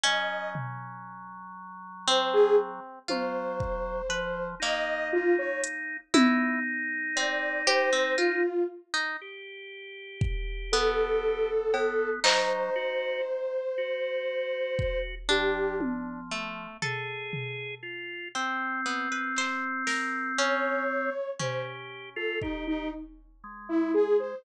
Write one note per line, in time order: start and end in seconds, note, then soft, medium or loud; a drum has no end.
0.03 2.80 F#3 medium
0.03 1.86 C#4 loud
0.03 0.50 D#5 medium
0.55 floor tom medium
2.07 2.99 C4 loud
2.07 2.31 C5 medium
2.07 closed hi-hat medium
2.33 2.56 G#4 loud
3.08 4.02 F#3 medium
3.08 4.00 F4 medium
3.08 4.46 C5 medium
3.08 high tom medium
3.60 kick medium
4.09 4.55 F3 medium
4.09 4.56 B4 medium
4.60 6.00 A#3 medium
4.60 5.97 D#4 medium
4.60 5.08 D#5 medium
4.60 clap medium
5.13 5.36 F4 medium
5.38 5.61 C#5 medium
5.64 closed hi-hat loud
6.14 8.43 D#4 loud
6.14 6.60 E4 loud
6.14 high tom loud
7.16 7.62 C4 medium
7.16 7.62 D5 medium
7.67 7.90 G4 loud
7.67 8.13 C5 medium
7.93 8.15 C4 medium
8.18 8.41 F4 medium
8.18 8.64 F4 medium
8.94 9.17 D#4 medium
9.21 11.50 G4 medium
10.21 kick loud
10.72 12.10 B3 loud
10.72 12.10 A4 medium
11.74 12.20 B3 medium
11.74 cowbell loud
12.24 12.70 F#3 medium
12.24 13.61 D#4 loud
12.24 14.99 C5 medium
12.24 clap loud
12.76 13.21 F#4 medium
13.78 15.15 F#4 medium
14.79 kick medium
15.29 16.67 F3 medium
15.29 16.20 D4 medium
15.29 15.75 G4 medium
15.81 high tom medium
16.31 16.77 A3 medium
16.82 17.75 G#4 medium
16.82 18.19 A4 medium
16.82 floor tom medium
17.33 floor tom medium
17.83 18.28 F4 medium
18.35 18.81 C4 medium
18.35 21.10 C4 loud
18.86 19.08 B3 medium
19.12 19.35 B4 medium
19.36 19.84 C5 medium
19.36 clap medium
19.87 20.33 A#4 medium
19.87 snare medium
20.38 20.84 C#4 medium
20.38 21.30 C#5 medium
21.39 24.14 C#4 medium
21.39 22.10 G4 medium
21.39 21.62 C5 medium
21.39 floor tom medium
22.16 22.39 F4 loud
22.16 22.39 A4 medium
22.42 22.64 D#4 medium
22.42 22.88 G4 medium
22.42 kick medium
22.67 22.90 D#4 medium
23.44 24.35 G#3 medium
23.69 23.92 E4 loud
23.94 24.17 G#4 medium
24.19 24.42 C5 medium